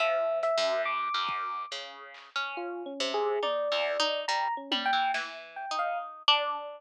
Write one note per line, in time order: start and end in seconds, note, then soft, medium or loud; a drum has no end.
0.00 0.51 F3 medium
0.00 0.39 E5 loud
0.43 0.82 E5 loud
0.43 closed hi-hat medium
0.58 1.09 F#2 medium
0.86 1.63 D6 medium
1.14 1.66 F#2 medium
1.29 kick loud
1.71 2.30 C#3 medium
1.71 clap medium
2.14 clap medium
2.36 2.94 C#4 medium
2.57 2.83 F4 medium
2.86 3.12 C#4 medium
3.00 3.39 C3 medium
3.14 3.40 G#4 loud
3.43 3.68 D#4 medium
3.43 4.20 D5 loud
3.43 high tom medium
3.72 3.97 E2 medium
4.00 4.25 D#4 loud
4.28 4.48 G3 medium
4.28 4.54 A#5 loud
4.57 4.83 C#4 medium
4.71 4.91 G3 medium
4.71 high tom loud
4.86 5.11 G5 loud
4.93 5.12 E3 medium
5.14 5.66 E3 medium
5.14 snare loud
5.56 5.76 G5 medium
5.71 6.23 D#4 medium
5.79 5.98 F5 medium
6.28 6.79 D4 loud